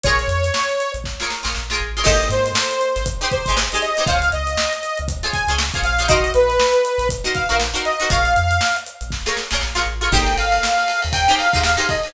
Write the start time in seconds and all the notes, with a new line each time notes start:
0.03 A#1 F4 G#4 A#4 C#5, kick, closed hi-hat
0.08 C#5
0.19 closed hi-hat
0.28 F2, closed hi-hat
0.44 closed hi-hat
0.54 snare
0.69 closed hi-hat
0.80 closed hi-hat
0.94 A#1, closed hi-hat
1.04 kick, snare
1.20 F4 G#4 A#4 C#5, snare
1.30 snare
1.43 A#1 F4 G#4 A#4 C#5, snare
1.55 A#1, snare
1.70 F4 G#4 A#4 C#5, snare
1.80 A1
1.97 F4 G#4 A#4 C#5
2.04 G#1 D#4 G4 G#4 C5 D#5, kick, crash
2.21 closed hi-hat
2.29 G#2 C5, closed hi-hat
2.46 closed hi-hat
2.55 snare
2.71 closed hi-hat
2.81 closed hi-hat
2.96 G#1, snare, closed hi-hat
3.06 kick, closed hi-hat
3.21 D#4 G4 G#4 C5, closed hi-hat
3.31 C5, kick, closed hi-hat
3.46 G#1 D#4 G4 G#4, kick, closed hi-hat
3.50 C5
3.57 snare
3.72 D#4 G4 G#4 C5, closed hi-hat
3.82 D#5, snare, closed hi-hat
3.97 D#4 G4 G#4 C5, closed hi-hat
4.07 C#2 F4 G#4 C5 C#5 F5, kick, closed hi-hat
4.22 closed hi-hat
4.32 C#2 D#5, closed hi-hat
4.47 closed hi-hat
4.57 snare
4.73 closed hi-hat
4.83 closed hi-hat
4.97 C#2, closed hi-hat
5.08 kick, closed hi-hat
5.23 F4 G#4 C5 C#5, closed hi-hat
5.33 G#5, kick, closed hi-hat
5.48 C#2 F4 G#4 C5 C#5, closed hi-hat
5.58 snare
5.74 F4 G#4 C5 C#5, kick, closed hi-hat
5.82 A#1 F5, closed hi-hat
5.99 F4 G#4 C5 C#5, snare, closed hi-hat
6.08 D#4 F#4 A#4 C5 D#5, kick, closed hi-hat
6.24 closed hi-hat
6.34 A#1 B4, closed hi-hat
6.50 closed hi-hat
6.60 snare
6.74 closed hi-hat
6.85 closed hi-hat
6.98 A#1, closed hi-hat
7.09 kick, closed hi-hat
7.24 D#4 F#4 A#4 C5, snare, closed hi-hat
7.35 F5, kick, closed hi-hat
7.49 A#1 D#4 F#4 A#4 C5, closed hi-hat
7.60 snare
7.74 D#4 F#4 A#4 C5, snare, closed hi-hat
7.85 D#5, closed hi-hat
8.00 D#4 F#4 A#4 C5, closed hi-hat
8.10 A#1 F4 G#4 A#4 C#5 F5, kick, closed hi-hat
8.25 closed hi-hat
8.36 F2, closed hi-hat
8.51 closed hi-hat
8.61 snare
8.76 closed hi-hat
8.86 closed hi-hat
9.01 A#1, closed hi-hat
9.11 kick, snare
9.26 F4 G#4 A#4 C#5, snare
9.37 snare
9.51 A#1 F4 G#4 A#4 C#5, snare
9.61 A#1, snare
9.75 F4 G#4 A#4 C#5, snare
9.86 A1
10.01 F4 G#4 A#4 C#5
10.12 G#1 D#4 G4 G#4 C5 G5, kick, crash
10.27 snare, ride
10.37 G#1 F5, snare, ride
10.52 ride
10.63 snare
10.78 ride
10.88 snare, ride
11.02 D#2, snare, ride
11.13 G5, kick, ride
11.28 D#4 G4 G#4 C5, snare, ride
11.38 F5, snare, ride
11.53 D#2 D#4 G4 G#4 C5, kick, ride
11.63 F5, snare
11.77 D#4 G4 G#4 C5, ride
11.89 D#5, kick, ride
12.03 D#4 G4 G#4, ride
12.08 C5